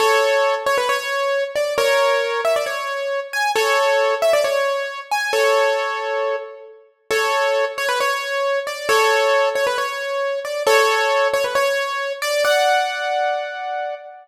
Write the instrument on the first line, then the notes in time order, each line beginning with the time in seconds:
acoustic grand piano
0.00 A4 C#5
0.66 C#5
0.78 B4
0.89 C#5
1.56 D5
1.78 A#4 C#5
2.45 E5
2.56 D5
2.66 C#5
3.33 G#5
3.56 A4 C#5
4.22 E5
4.33 D5
4.44 C#5
5.11 G#5
5.33 A4 C#5
7.11 A4 C#5
7.78 C#5
7.89 B4
8.00 C#5
8.67 D5
8.89 A4 C#5
9.55 C#5
9.67 B4
9.78 C#5
10.45 D5
10.67 A4 C#5
11.34 C#5
11.44 B4
11.55 C#5
12.22 D5
12.45 D5 F#5